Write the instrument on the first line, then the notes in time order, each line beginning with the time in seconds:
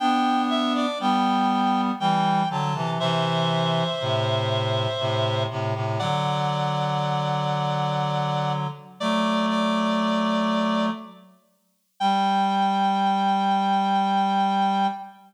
clarinet
0.00 B3 D4 G5
0.50 E5
0.75 D5
1.00 G3 B3 G5
2.00 E3 G3 G5
2.50 D3 F#3 A5
2.75 C3 E3
3.00 C3 E3 C5 E5
4.01 A2 C3
5.00 A2 C3
5.50 A2 C3
5.75 A2 C3
5.99 D3 F#3 D5 F#5
9.00 F#3 A3 D5
9.49 D5
12.00 G3 G5